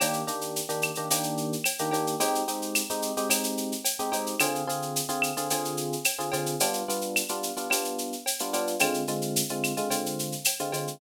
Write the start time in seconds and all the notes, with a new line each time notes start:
0.00 D#3 A#3 D4 G4, cowbell, claves, shaker
0.13 shaker
0.27 D#3 A#3 D4 G4, shaker
0.41 shaker
0.56 shaker
0.69 D#3 A#3 D4 G4, shaker
0.82 claves, shaker
0.95 D#3 A#3 D4 G4, shaker
1.10 D#3 A#3 D4 G4, cowbell, shaker
1.23 shaker
1.37 shaker
1.53 shaker
1.64 cowbell, claves, shaker
1.79 D#3 A#3 D4 G4, shaker
1.91 D#3 A#3 D4 G4, cowbell, shaker
2.07 shaker
2.20 G#3 C4 D#4 G4, cowbell, shaker
2.35 shaker
2.48 G#3 C4 D#4 G4, shaker
2.62 shaker
2.75 claves, shaker
2.90 G#3 C4 D#4 G4, shaker
3.02 shaker
3.17 G#3 C4 D#4 G4, shaker
3.29 G#3 C4 D#4 G4, cowbell, claves, shaker
3.44 shaker
3.57 shaker
3.72 shaker
3.85 cowbell, shaker
3.99 G#3 C4 D#4 G4, shaker
4.12 G#3 C4 D#4 G4, cowbell, shaker
4.26 shaker
4.40 D3 C4 F4 G#4, cowbell, claves, shaker
4.55 shaker
4.67 D3 C4 F4 G#4, shaker
4.82 shaker
4.96 shaker
5.09 D3 C4 F4 G#4, shaker
5.22 claves, shaker
5.37 D3 C4 F4 G#4, shaker
5.50 D3 C4 F4 G#4, cowbell, shaker
5.65 shaker
5.77 shaker
5.92 shaker
6.04 cowbell, claves, shaker
6.19 D3 C4 F4 G#4, shaker
6.32 D3 C4 F4 G#4, cowbell, shaker
6.46 shaker
6.60 G3 B3 D4 F4, cowbell, shaker
6.73 shaker
6.88 G3 B3 D4 F4, shaker
7.01 shaker
7.16 claves, shaker
7.29 G3 B3 D4 F4, shaker
7.43 shaker
7.57 G3 B3 D4 F4, shaker
7.70 G3 B3 D4 F4, cowbell, claves, shaker
7.85 shaker
7.98 shaker
8.12 shaker
8.26 cowbell, shaker
8.39 G3 B3 D4 F4, shaker
8.53 G3 B3 D4 F4, cowbell, shaker
8.67 shaker
8.79 D3 G#3 C4 F4, cowbell, claves, shaker
8.94 shaker
9.07 D3 G#3 C4 F4, shaker
9.22 shaker
9.36 shaker
9.49 D3 G#3 C4 F4, shaker
9.64 claves, shaker
9.77 D3 G#3 C4 F4, shaker
9.90 D3 G#3 C4 F4, cowbell, shaker
10.06 shaker
10.19 shaker
10.32 shaker
10.44 cowbell, claves, shaker
10.59 D3 G#3 C4 F4, shaker
10.72 D3 G#3 C4 F4, cowbell, shaker
10.87 shaker